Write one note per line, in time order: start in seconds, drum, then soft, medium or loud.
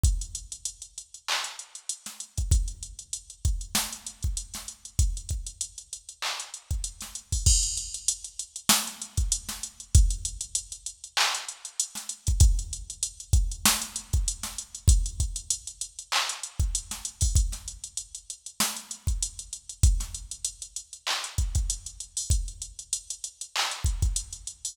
0.03 kick loud
0.03 closed hi-hat loud
0.21 closed hi-hat medium
0.35 closed hi-hat medium
0.52 closed hi-hat medium
0.65 closed hi-hat loud
0.82 closed hi-hat medium
0.98 closed hi-hat medium
1.14 closed hi-hat medium
1.28 clap loud
1.44 closed hi-hat medium
1.59 closed hi-hat medium
1.75 closed hi-hat medium
1.89 closed hi-hat loud
2.06 snare medium
2.06 closed hi-hat medium
2.20 closed hi-hat medium
2.38 kick medium
2.38 closed hi-hat medium
2.51 kick loud
2.51 closed hi-hat loud
2.68 closed hi-hat medium
2.83 closed hi-hat medium
2.99 closed hi-hat medium
3.13 closed hi-hat loud
3.30 closed hi-hat medium
3.45 kick medium
3.45 closed hi-hat medium
3.61 closed hi-hat medium
3.75 snare loud
3.93 closed hi-hat medium
4.07 closed hi-hat medium
4.23 kick medium
4.23 closed hi-hat medium
4.37 closed hi-hat loud
4.54 snare medium
4.54 closed hi-hat medium
4.68 closed hi-hat medium
4.85 closed hi-hat medium
4.99 kick loud
4.99 closed hi-hat loud
5.17 closed hi-hat medium
5.29 kick medium
5.29 closed hi-hat medium
5.47 closed hi-hat medium
5.61 closed hi-hat loud
5.78 closed hi-hat medium
5.93 closed hi-hat medium
6.09 closed hi-hat medium
6.22 clap loud
6.40 closed hi-hat medium
6.54 closed hi-hat medium
6.71 kick medium
6.71 closed hi-hat medium
6.84 closed hi-hat loud
7.01 snare medium
7.01 closed hi-hat medium
7.15 closed hi-hat medium
7.32 kick medium
7.32 open hi-hat medium
7.46 kick loud
7.46 crash loud
7.63 closed hi-hat medium
7.77 closed hi-hat medium
7.94 closed hi-hat medium
8.08 closed hi-hat loud
8.24 closed hi-hat medium
8.39 closed hi-hat loud
8.56 closed hi-hat medium
8.69 snare loud
8.87 closed hi-hat medium
9.02 closed hi-hat medium
9.17 kick medium
9.17 closed hi-hat medium
9.32 closed hi-hat loud
9.49 snare medium
9.49 closed hi-hat medium
9.63 closed hi-hat medium
9.80 closed hi-hat medium
9.95 kick loud
9.95 closed hi-hat loud
10.10 closed hi-hat medium
10.25 closed hi-hat loud
10.41 closed hi-hat loud
10.55 closed hi-hat loud
10.72 closed hi-hat medium
10.86 closed hi-hat medium
11.04 closed hi-hat medium
11.17 clap loud
11.35 closed hi-hat medium
11.49 closed hi-hat medium
11.65 closed hi-hat medium
11.80 closed hi-hat loud
11.95 snare medium
11.95 closed hi-hat medium
12.09 closed hi-hat loud
12.27 kick medium
12.27 closed hi-hat medium
12.40 kick loud
12.40 closed hi-hat loud
12.59 closed hi-hat medium
12.73 closed hi-hat medium
12.90 closed hi-hat medium
13.03 closed hi-hat loud
13.20 closed hi-hat medium
13.33 kick loud
13.33 closed hi-hat loud
13.52 closed hi-hat medium
13.65 snare loud
13.82 closed hi-hat medium
13.96 closed hi-hat loud
14.13 kick loud
14.13 closed hi-hat medium
14.28 closed hi-hat loud
14.43 snare medium
14.43 closed hi-hat medium
14.58 closed hi-hat medium
14.75 closed hi-hat medium
14.88 kick loud
14.88 closed hi-hat loud
15.06 closed hi-hat medium
15.20 kick medium
15.20 closed hi-hat medium
15.36 closed hi-hat medium
15.50 closed hi-hat loud
15.67 closed hi-hat medium
15.81 closed hi-hat loud
15.99 closed hi-hat medium
16.12 clap loud
16.29 closed hi-hat loud
16.43 closed hi-hat medium
16.60 kick medium
16.60 closed hi-hat medium
16.75 closed hi-hat loud
16.91 snare medium
16.91 closed hi-hat medium
17.05 closed hi-hat loud
17.21 kick medium
17.21 open hi-hat medium
17.36 kick loud
17.36 closed hi-hat loud
17.52 snare soft
17.52 closed hi-hat medium
17.68 closed hi-hat medium
17.84 closed hi-hat medium
17.97 closed hi-hat loud
18.15 closed hi-hat medium
18.30 closed hi-hat medium
18.46 closed hi-hat medium
18.60 snare loud
18.77 closed hi-hat medium
18.91 closed hi-hat medium
19.07 kick medium
19.07 closed hi-hat medium
19.23 closed hi-hat loud
19.39 closed hi-hat medium
19.53 closed hi-hat medium
19.69 closed hi-hat medium
19.83 kick loud
19.83 closed hi-hat loud
20.00 snare soft
20.00 closed hi-hat medium
20.15 closed hi-hat medium
20.31 closed hi-hat medium
20.45 closed hi-hat loud
20.62 closed hi-hat medium
20.76 closed hi-hat medium
20.93 closed hi-hat medium
21.07 clap loud
21.24 closed hi-hat medium
21.38 kick medium
21.38 closed hi-hat medium
21.55 kick medium
21.55 closed hi-hat medium
21.70 closed hi-hat loud
21.86 closed hi-hat medium
22.00 closed hi-hat medium
22.17 open hi-hat medium
22.30 kick loud
22.30 closed hi-hat loud
22.48 closed hi-hat medium
22.62 closed hi-hat medium
22.79 closed hi-hat medium
22.93 closed hi-hat loud
23.10 closed hi-hat medium
23.24 closed hi-hat medium
23.41 closed hi-hat medium
23.56 clap loud
23.71 closed hi-hat medium
23.84 kick medium
23.84 closed hi-hat medium
24.02 kick medium
24.02 closed hi-hat medium
24.16 closed hi-hat loud
24.33 closed hi-hat medium
24.47 closed hi-hat medium
24.65 open hi-hat medium